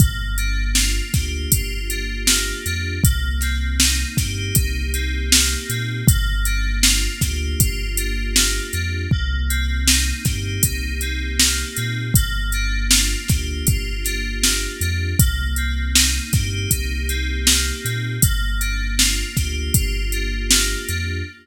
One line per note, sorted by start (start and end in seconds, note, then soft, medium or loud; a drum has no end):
0.00 1.01 G1 loud
0.00 2.28 A#3 medium
0.00 kick loud
0.00 closed hi-hat medium
0.38 1.89 D4 medium
0.38 closed hi-hat medium
0.75 1.52 F4 medium
0.75 snare loud
1.14 1.47 D2 medium
1.14 2.96 G4 medium
1.14 kick medium
1.14 snare medium
1.14 closed hi-hat medium
1.52 2.53 G1 medium
1.52 2.98 F4 medium
1.52 kick medium
1.52 closed hi-hat loud
1.90 2.65 D4 medium
1.90 closed hi-hat medium
2.27 3.01 A#3 medium
2.27 snare loud
2.66 2.99 F2 medium
2.66 3.02 D4 medium
2.66 closed hi-hat medium
3.04 4.04 C2 loud
3.04 5.31 A#3 loud
3.04 kick loud
3.04 closed hi-hat loud
3.41 4.93 C4 medium
3.41 snare soft
3.41 closed hi-hat medium
3.80 4.55 D#4 medium
3.80 snare loud
4.17 4.52 G2 medium
4.17 6.00 G4 medium
4.17 kick medium
4.17 snare medium
4.17 closed hi-hat medium
4.55 5.56 C2 medium
4.55 6.02 D#4 medium
4.55 kick medium
4.55 closed hi-hat loud
4.94 5.69 C4 medium
4.94 closed hi-hat medium
5.31 6.04 A#3 medium
5.31 snare loud
5.69 6.03 A#2 medium
5.69 6.06 C4 medium
5.69 closed hi-hat medium
6.07 7.08 G1 loud
6.07 8.35 A#3 loud
6.07 kick loud
6.07 closed hi-hat loud
6.45 7.97 D4 medium
6.45 closed hi-hat medium
6.83 7.59 F4 medium
6.83 snare loud
7.21 7.55 D2 medium
7.21 9.04 G4 medium
7.21 kick medium
7.21 snare medium
7.21 closed hi-hat medium
7.59 8.60 G1 medium
7.59 9.06 F4 medium
7.59 kick medium
7.59 closed hi-hat loud
7.97 8.73 D4 medium
7.97 closed hi-hat medium
8.36 9.09 A#3 medium
8.36 snare loud
8.73 9.07 F2 medium
8.73 9.10 D4 medium
8.73 closed hi-hat medium
9.11 10.12 C2 loud
9.11 11.39 A#3 medium
9.11 kick medium
9.49 11.01 C4 medium
9.49 closed hi-hat medium
9.87 10.63 D#4 medium
9.87 snare loud
10.25 10.59 G2 medium
10.25 12.08 G4 medium
10.25 kick medium
10.25 snare medium
10.25 closed hi-hat medium
10.63 11.64 C2 medium
10.63 12.10 D#4 medium
10.63 kick medium
10.63 closed hi-hat loud
11.01 11.77 C4 medium
11.01 closed hi-hat medium
11.39 12.12 A#3 medium
11.39 snare loud
11.77 12.11 A#2 medium
11.77 12.13 C4 medium
11.77 closed hi-hat medium
12.14 13.15 G1 loud
12.14 14.43 A#3 loud
12.14 kick loud
12.14 closed hi-hat loud
12.52 14.05 D4 medium
12.52 closed hi-hat medium
12.91 13.67 F4 medium
12.91 snare loud
13.28 13.63 D2 medium
13.28 15.12 G4 medium
13.28 kick medium
13.28 snare medium
13.28 closed hi-hat medium
13.67 14.67 G1 medium
13.67 15.13 F4 medium
13.67 kick medium
13.67 closed hi-hat loud
14.05 14.81 D4 medium
14.05 snare soft
14.05 closed hi-hat medium
14.43 15.16 A#3 medium
14.43 snare loud
14.81 15.14 F2 medium
14.81 15.18 D4 medium
14.81 closed hi-hat medium
15.19 16.19 C2 loud
15.19 17.47 A#3 loud
15.19 kick loud
15.19 closed hi-hat loud
15.56 17.08 C4 medium
15.56 closed hi-hat medium
15.95 16.71 D#4 medium
15.95 snare loud
16.33 16.66 G2 medium
16.33 18.16 G4 medium
16.33 kick medium
16.33 snare medium
16.33 closed hi-hat medium
16.71 17.72 C2 medium
16.71 18.17 D#4 medium
16.71 kick medium
16.71 closed hi-hat loud
17.09 17.84 C4 medium
17.09 closed hi-hat medium
17.47 18.20 A#3 medium
17.47 snare loud
17.84 18.18 A#2 medium
17.84 18.21 C4 medium
17.84 closed hi-hat medium
18.22 19.24 G1 medium
18.22 20.50 A#3 loud
18.22 kick loud
18.22 closed hi-hat loud
18.61 20.12 D4 medium
18.61 closed hi-hat medium
18.99 19.74 F4 medium
18.99 snare loud
19.37 19.70 D2 medium
19.37 21.19 G4 medium
19.37 kick medium
19.37 snare medium
19.37 closed hi-hat medium
19.74 20.75 G1 medium
19.74 21.20 F4 medium
19.74 kick medium
19.74 closed hi-hat loud
20.12 20.88 D4 medium
20.12 closed hi-hat medium
20.50 21.24 A#3 medium
20.50 snare loud
20.89 21.23 F2 medium
20.89 21.25 D4 medium
20.89 closed hi-hat medium